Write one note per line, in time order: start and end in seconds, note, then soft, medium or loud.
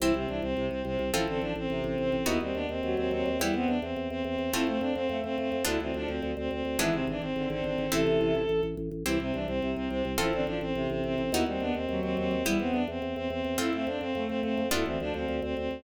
0.00 0.12 C2 medium
0.00 0.12 E3 loud
0.00 1.03 C4 loud
0.00 0.14 E4 loud
0.00 1.03 E4 loud
0.00 1.03 G4 loud
0.14 0.26 C2 medium
0.14 0.27 C3 loud
0.14 0.28 C4 medium
0.27 0.41 C2 medium
0.27 0.42 E3 medium
0.27 0.40 D4 medium
0.42 0.54 C2 medium
0.42 0.66 C4 medium
0.57 0.69 C2 medium
0.57 1.02 C3 loud
0.70 0.83 C2 medium
0.70 0.82 C4 medium
0.85 0.97 C2 medium
0.85 1.09 C4 medium
0.99 1.11 C2 medium
1.13 1.25 A1 medium
1.13 1.27 F3 loud
1.13 2.16 C4 loud
1.13 1.25 E4 loud
1.13 2.16 F4 loud
1.13 2.16 A4 loud
1.28 1.40 A1 medium
1.28 1.40 D3 loud
1.28 1.41 C4 medium
1.41 1.54 A1 medium
1.41 1.53 F3 loud
1.41 1.53 D4 medium
1.56 1.68 A1 medium
1.56 1.84 C4 medium
1.70 1.82 A1 medium
1.70 2.16 C3 loud
1.84 1.96 A1 medium
1.84 1.98 C4 medium
1.98 2.10 A1 medium
1.98 2.26 C4 medium
2.12 2.24 A1 medium
2.25 2.39 D#2 medium
2.25 3.28 B3 loud
2.25 2.40 B3 loud
2.25 3.28 D#4 loud
2.25 2.37 E4 loud
2.25 3.28 F#4 loud
2.41 2.53 D#2 medium
2.41 2.55 G3 medium
2.41 2.55 C4 medium
2.54 2.67 D#2 medium
2.54 2.67 B3 loud
2.54 2.67 D4 loud
2.69 2.81 D#2 medium
2.69 2.94 C4 medium
2.83 2.95 D#2 medium
2.83 3.29 F#3 loud
2.97 3.09 D#2 medium
2.97 3.10 C4 medium
3.11 3.23 D#2 medium
3.11 3.37 C4 loud
3.26 3.38 D#2 medium
3.40 3.52 E2 medium
3.40 3.53 G3 loud
3.40 4.43 B3 loud
3.40 4.43 E4 loud
3.40 3.54 E4 loud
3.40 4.43 G4 loud
3.54 3.66 E2 medium
3.54 3.77 B3 loud
3.54 3.68 C4 medium
3.67 3.80 E2 medium
3.67 3.80 D4 medium
3.82 3.94 E2 medium
3.82 4.08 C4 medium
3.96 4.08 E2 medium
4.10 4.22 E2 medium
4.10 4.23 C4 medium
4.24 4.36 E2 medium
4.24 4.52 C4 medium
4.38 4.50 E2 medium
4.53 4.65 F2 medium
4.53 5.55 A3 loud
4.53 4.66 C4 loud
4.53 5.55 C4 loud
4.53 4.66 E4 loud
4.53 5.55 F4 loud
4.67 4.79 F2 medium
4.67 4.79 A3 loud
4.67 4.81 C4 medium
4.80 4.93 F2 medium
4.80 4.94 C4 loud
4.80 4.94 D4 medium
4.95 5.07 F2 medium
4.95 5.18 C4 loud
5.09 5.21 F2 medium
5.09 5.57 A3 loud
5.24 5.36 F2 medium
5.24 5.37 C4 loud
5.38 5.50 F2 medium
5.38 5.62 C4 medium
5.52 5.64 F2 medium
5.65 5.78 D2 medium
5.65 5.78 D3 loud
5.65 6.66 B3 loud
5.65 6.66 D4 loud
5.65 5.79 E4 loud
5.65 6.66 F4 loud
5.80 5.92 D2 medium
5.80 5.92 E3 loud
5.80 5.95 C4 medium
5.94 6.06 D2 medium
5.94 6.31 F3 loud
5.94 6.08 D4 medium
6.07 6.20 D2 medium
6.07 6.32 C4 medium
6.22 6.34 D2 medium
6.37 6.49 D2 medium
6.37 6.50 C4 medium
6.51 6.63 D2 medium
6.51 6.78 C4 medium
6.65 6.77 D2 medium
6.79 6.91 G#1 medium
6.79 6.93 E3 loud
6.79 7.81 G#3 loud
6.79 7.81 B3 loud
6.79 7.81 D4 loud
6.79 7.81 E4 loud
6.79 6.94 E4 loud
6.93 7.05 G#1 medium
6.93 7.06 C3 loud
6.93 7.05 C4 medium
7.07 7.19 G#1 medium
7.07 7.21 E3 loud
7.07 7.21 D4 medium
7.21 7.34 G#1 medium
7.21 7.48 C4 medium
7.36 7.48 G#1 medium
7.36 7.86 D3 loud
7.50 7.62 G#1 medium
7.50 7.64 C4 medium
7.64 7.76 G#1 medium
7.64 7.90 C4 medium
7.78 7.90 G#1 medium
7.92 8.04 A1 medium
7.92 8.42 C3 loud
7.92 8.42 E3 loud
7.92 8.94 A3 loud
7.92 8.94 C4 loud
7.92 8.94 E4 loud
7.92 8.61 A4 loud
8.07 8.19 A1 medium
8.21 8.33 A1 medium
8.35 8.47 A1 medium
8.49 8.61 A1 medium
8.63 8.75 A1 medium
8.77 8.89 A1 medium
8.91 9.03 A1 medium
9.06 9.18 C2 medium
9.06 9.18 E3 loud
9.06 10.08 C4 loud
9.06 9.18 E4 loud
9.06 10.08 E4 loud
9.06 10.08 G4 loud
9.20 9.32 C2 medium
9.20 9.32 C3 loud
9.20 9.35 C4 medium
9.33 9.46 C2 medium
9.33 9.47 E3 medium
9.33 9.46 D4 medium
9.47 9.60 C2 medium
9.47 9.71 C4 medium
9.61 9.74 C2 medium
9.61 10.07 C3 loud
9.76 9.89 C2 medium
9.76 9.88 C4 medium
9.89 10.03 C2 medium
9.89 10.12 C4 medium
10.05 10.17 C2 medium
10.18 10.31 A1 medium
10.18 10.33 F3 loud
10.18 11.20 C4 loud
10.18 10.31 E4 loud
10.18 11.20 F4 loud
10.18 11.20 A4 loud
10.32 10.45 A1 medium
10.32 10.46 D3 loud
10.32 10.45 C4 medium
10.46 10.59 A1 medium
10.46 10.60 F3 loud
10.46 10.58 D4 medium
10.61 10.73 A1 medium
10.61 10.87 C4 medium
10.75 10.87 A1 medium
10.75 11.21 C3 loud
10.90 11.02 A1 medium
10.90 11.03 C4 medium
11.04 11.16 A1 medium
11.04 11.31 C4 medium
11.18 11.30 A1 medium
11.32 11.44 D#2 medium
11.32 11.46 B3 loud
11.32 12.36 B3 loud
11.32 12.36 D#4 loud
11.32 11.43 E4 loud
11.32 12.36 F#4 loud
11.46 11.58 D#2 medium
11.46 11.60 G3 medium
11.46 11.62 C4 medium
11.60 11.72 D#2 medium
11.60 11.73 B3 loud
11.60 11.73 D4 loud
11.74 11.87 D#2 medium
11.74 12.00 C4 medium
11.89 12.01 D#2 medium
11.89 12.35 F#3 loud
12.02 12.15 D#2 medium
12.02 12.16 C4 medium
12.17 12.29 D#2 medium
12.17 12.43 C4 loud
12.31 12.43 D#2 medium
12.45 12.57 E2 medium
12.45 12.59 G3 loud
12.45 13.48 B3 loud
12.45 12.58 E4 loud
12.45 13.48 E4 loud
12.45 13.48 G4 loud
12.58 12.72 E2 medium
12.58 12.82 B3 loud
12.58 12.72 C4 medium
12.72 12.86 E2 medium
12.72 12.85 D4 medium
12.88 13.00 E2 medium
12.88 13.15 C4 medium
13.02 13.14 E2 medium
13.16 13.28 E2 medium
13.16 13.28 C4 medium
13.30 13.42 E2 medium
13.30 13.56 C4 medium
13.45 13.57 E2 medium
13.58 13.71 F2 medium
13.58 14.60 A3 loud
13.58 14.60 C4 loud
13.58 13.72 C4 loud
13.58 13.73 E4 loud
13.58 14.60 F4 loud
13.73 13.85 F2 medium
13.73 13.85 A3 loud
13.73 13.88 C4 medium
13.87 13.99 F2 medium
13.87 14.01 C4 loud
13.87 14.01 D4 medium
14.00 14.13 F2 medium
14.00 14.23 C4 loud
14.15 14.27 F2 medium
14.15 14.62 A3 loud
14.28 14.41 F2 medium
14.28 14.40 C4 loud
14.43 14.55 F2 medium
14.43 14.67 C4 medium
14.58 14.70 F2 medium
14.71 14.84 D2 medium
14.71 14.84 D3 loud
14.71 15.73 B3 loud
14.71 15.73 D4 loud
14.71 14.85 E4 loud
14.71 15.73 F4 loud
14.85 14.98 D2 medium
14.85 14.97 E3 loud
14.85 14.98 C4 medium
15.00 15.12 D2 medium
15.00 15.36 F3 loud
15.00 15.13 D4 medium
15.14 15.26 D2 medium
15.14 15.40 C4 medium
15.28 15.40 D2 medium
15.42 15.54 D2 medium
15.42 15.55 C4 medium
15.57 15.69 D2 medium
15.57 15.83 C4 medium
15.71 15.83 D2 medium